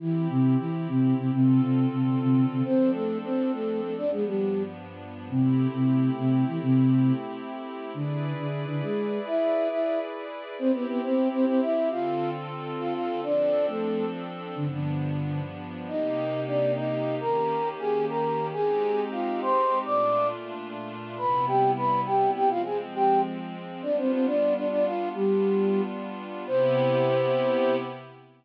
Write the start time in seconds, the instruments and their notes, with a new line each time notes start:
0.00 flute E3 E4, pad 5 (bowed) C4 E4 G4
0.29 flute C3 C4
0.59 flute E3 E4
0.88 flute C3 C4
1.18 flute C3 C4
1.32 flute C3 C4, pad 5 (bowed) D3 C4 F4 A4
1.62 flute C3 C4
1.91 flute C3 C4
2.21 flute C3 C4
2.50 flute C3 C4
2.65 pad 5 (bowed) F3 C4 D4 A4, flute C4 C5
2.94 flute A3 A4
3.24 flute C4 C5
3.53 flute A3 A4
3.82 flute A3 A4
3.97 pad 5 (bowed) G2 F3 B3 D4, flute D4 D5
4.12 flute G#3 G#4
4.26 flute G3 G4
5.29 flute C3 C4, pad 5 (bowed) A3 C4 E4 G4
5.74 flute C3 C4
6.18 flute C3 C4
6.47 flute E3 E4
6.62 flute C3 C4
7.94 flute D3 D4, pad 5 (bowed) E4 G#4 B4 D5
8.38 flute D3 D4
8.68 flute D3 D4
8.82 flute G#3 G#4
9.26 flute E4 E5
9.71 flute E4 E5
10.59 flute C4 C5, pad 5 (bowed) C4 E4 G4
10.74 flute B3 B4
10.88 flute B3 B4
11.03 flute C4 C5
11.32 flute C4 C5
11.47 flute C4 C5
11.62 flute E4 E5
11.91 pad 5 (bowed) D3 C4 F4 A4, flute F4 F5
12.79 flute F4 F5
12.94 flute F4 F5
13.23 pad 5 (bowed) F3 C4 D4 A4, flute D4 D5
13.68 flute A3 A4
14.56 pad 5 (bowed) G2 F3 B3 D4, flute D3 D4
14.71 flute D3 D4
15.88 pad 5 (bowed) C3 A#3 D#4 G4, flute D#4 D#5
16.47 flute D4 D5
16.76 flute D#4 D#5
17.21 pad 5 (bowed) D#3 A#3 C#4 G4, flute A#4 A#5
17.79 flute G#4 G#5
18.09 flute A#4 A#5
18.53 pad 5 (bowed) G#3 C4 D#4 G4, flute G#4 G#5
19.12 flute F4 F5
19.41 flute C5 C6
19.85 pad 5 (bowed) A#2 A3 D4 F4, flute D5 D6
21.18 pad 5 (bowed) C3 G3 B3 E4, flute B4 B5
21.47 flute G4 G5
21.76 flute B4 B5
22.06 flute G4 G5
22.35 flute G4 G5
22.50 pad 5 (bowed) F3 G#3 C4, flute F4 F5
22.65 flute G#4 G#5
22.94 flute G4 G5
23.82 pad 5 (bowed) G3 B3 D4 F4, flute D4 D5
23.97 flute C4 C5
24.12 flute C4 C5
24.26 flute D4 D5
24.56 flute D4 D5
24.71 flute D4 D5
24.85 flute F4 F5
25.15 flute G3 G4, pad 5 (bowed) G3 B3 D4 F4
26.47 pad 5 (bowed) C3 B3 E4 G4, flute C5